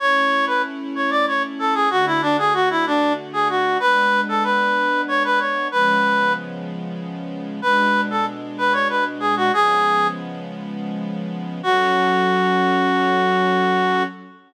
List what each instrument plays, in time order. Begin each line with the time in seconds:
0.00 string ensemble 1 A3 C#4 E4, clarinet C#5
0.47 clarinet B4
0.95 clarinet C#5
1.10 clarinet D5
1.27 clarinet C#5
1.59 clarinet A4
1.74 clarinet G#4
1.90 string ensemble 1 D3 A3 F#4, clarinet F#4
2.06 clarinet E4
2.22 clarinet D4
2.38 clarinet G#4
2.54 clarinet F#4
2.70 clarinet E4
2.86 clarinet D4
3.33 clarinet G#4
3.49 clarinet F#4
3.80 string ensemble 1 G#3 B3 D4, clarinet B4
4.29 clarinet A4
4.44 clarinet B4
5.08 clarinet C#5
5.24 clarinet B4
5.39 clarinet C#5
5.72 string ensemble 1 C#3 F3 G#3 B3, clarinet B4
7.62 string ensemble 1 B2 G#3 D4, clarinet B4
8.10 clarinet A4
8.58 clarinet B4
8.73 clarinet C#5
8.89 clarinet B4
9.20 clarinet G#4
9.37 clarinet F#4
9.52 string ensemble 1 C#3 F3 G#3 B3, clarinet G#4
11.63 string ensemble 1 F#3 C#4 A4, clarinet F#4